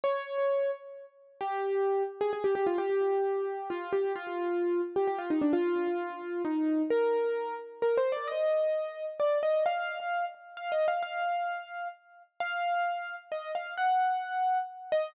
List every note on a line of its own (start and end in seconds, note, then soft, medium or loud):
0.04 0.71 C#5 loud
1.41 2.03 G4 loud
2.21 2.32 G#4 loud
2.33 2.44 G#4 medium
2.44 2.55 G4 medium
2.55 2.66 G4 loud
2.67 2.77 F4 loud
2.78 3.68 G4 loud
3.70 3.92 F4 loud
3.93 4.13 G4 medium
4.16 4.81 F4 loud
4.96 5.07 G4 medium
5.08 5.18 G4 medium
5.19 5.29 F4 medium
5.30 5.41 D#4 medium
5.42 5.52 D4 medium
5.53 6.42 F4 loud
6.45 6.82 D#4 medium
6.90 7.54 A#4 loud
7.82 7.97 A#4 medium
7.98 8.12 C5 loud
8.12 8.27 D5 medium
8.28 9.06 D#5 medium
9.20 9.38 D5 medium
9.43 9.64 D#5 medium
9.66 10.25 F5 loud
10.57 10.72 F5 medium
10.72 10.86 D#5 medium
10.88 11.02 F5 medium
11.03 11.88 F5 loud
12.40 13.15 F5 loud
13.32 13.51 D#5 medium
13.55 13.74 F5 medium
13.78 14.58 F#5 loud
14.92 15.14 D#5 loud